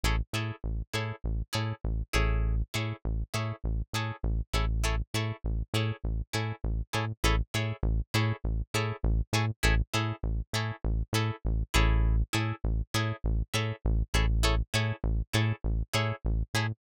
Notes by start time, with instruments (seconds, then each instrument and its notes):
0.04 synth bass 1 A1, acoustic guitar (steel) E4 G#4 A4 C#5
0.33 synth bass 1 A2, acoustic guitar (steel) E4 G#4 A4 C#5
0.64 synth bass 1 A1
0.94 synth bass 1 A2, acoustic guitar (steel) E4 G#4 A4 C#5
1.24 synth bass 1 A1
1.53 synth bass 1 A2, acoustic guitar (steel) E4 G#4 A4 C#5
1.84 synth bass 1 A1
2.13 synth bass 1 A1, acoustic guitar (steel) E4 G#4 A4 C#5
2.74 synth bass 1 A2, acoustic guitar (steel) E4 G#4 A4 C#5
3.05 synth bass 1 A1
3.34 synth bass 1 A2, acoustic guitar (steel) E4 G#4 A4 C#5
3.64 synth bass 1 A1
3.93 synth bass 1 A2, acoustic guitar (steel) E4 G#4 A4 C#5
4.23 synth bass 1 A1
4.54 synth bass 1 A1, acoustic guitar (steel) E4 G#4 A4 C#5
4.84 acoustic guitar (steel) E4 G#4 A4 C#5
5.14 synth bass 1 A2, acoustic guitar (steel) E4 G#4 A4 C#5
5.44 synth bass 1 A1
5.74 synth bass 1 A2, acoustic guitar (steel) E4 G#4 A4 C#5
6.04 synth bass 1 A1
6.33 synth bass 1 A2, acoustic guitar (steel) E4 G#4 A4 C#5
6.64 synth bass 1 A1
6.93 synth bass 1 A2, acoustic guitar (steel) E4 G#4 A4 C#5
7.24 synth bass 1 A1, acoustic guitar (steel) E4 G#4 A4 C#5
7.54 synth bass 1 A2, acoustic guitar (steel) E4 G#4 A4 C#5
7.83 synth bass 1 A1
8.14 synth bass 1 A2, acoustic guitar (steel) E4 G#4 A4 C#5
8.44 synth bass 1 A1
8.74 synth bass 1 A2, acoustic guitar (steel) E4 G#4 A4 C#5
9.03 synth bass 1 A1
9.33 synth bass 1 A2, acoustic guitar (steel) E4 G#4 A4 C#5
9.63 synth bass 1 A1, acoustic guitar (steel) E4 G#4 A4 C#5
9.94 synth bass 1 A2, acoustic guitar (steel) E4 G#4 A4 C#5
10.23 synth bass 1 A1
10.53 synth bass 1 A2, acoustic guitar (steel) E4 G#4 A4 C#5
10.85 synth bass 1 A1
11.13 synth bass 1 A2, acoustic guitar (steel) E4 G#4 A4 C#5
11.45 synth bass 1 A1
11.74 synth bass 1 A1, acoustic guitar (steel) E4 G#4 A4 C#5
12.33 synth bass 1 A2, acoustic guitar (steel) E4 G#4 A4 C#5
12.64 synth bass 1 A1
12.94 synth bass 1 A2, acoustic guitar (steel) E4 G#4 A4 C#5
13.24 synth bass 1 A1
13.54 synth bass 1 A2, acoustic guitar (steel) E4 G#4 A4 C#5
13.85 synth bass 1 A1
14.14 synth bass 1 A1, acoustic guitar (steel) E4 G#4 A4 C#5
14.43 acoustic guitar (steel) E4 G#4 A4 C#5
14.74 synth bass 1 A2, acoustic guitar (steel) E4 G#4 A4 C#5
15.04 synth bass 1 A1
15.34 synth bass 1 A2, acoustic guitar (steel) E4 G#4 A4 C#5
15.64 synth bass 1 A1
15.94 synth bass 1 A2, acoustic guitar (steel) E4 G#4 A4 C#5
16.25 synth bass 1 A1
16.54 synth bass 1 A2, acoustic guitar (steel) E4 G#4 A4 C#5